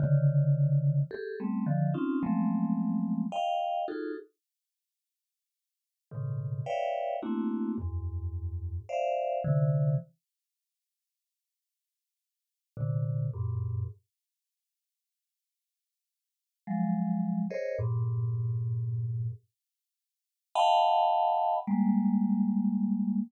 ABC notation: X:1
M:7/8
L:1/16
Q:1/4=54
K:none
V:1 name="Vibraphone"
[_D,=D,_E,]4 [G_A=A] [G,A,B,C] [D,E,F,] [C_D_EF] [F,_G,_A,=A,B,C]4 [_ef=g]2 | [_EF_G_A=A] z7 [_A,,=A,,B,,_D,_E,]2 [B_d=d=ef=g]2 [A,_B,CD=E_G]2 | [E,,_G,,_A,,]4 [cdef]2 [C,D,E,]2 z6 | z4 [_B,,C,D,]2 [_G,,=G,,_A,,B,,]2 z6 |
z4 [F,_G,_A,]3 [_A_Bc_d_e] [=G,,_A,,_B,,]6 | z4 [_ef_g=gab]4 [G,_A,_B,]6 |]